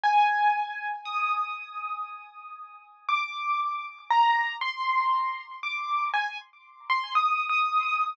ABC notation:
X:1
M:4/4
L:1/16
Q:1/4=59
K:Eb
V:1 name="Acoustic Grand Piano"
a4 e'8 d'4 | b2 c'4 d'2 a z2 c' (3e'2 e'2 e'2 |]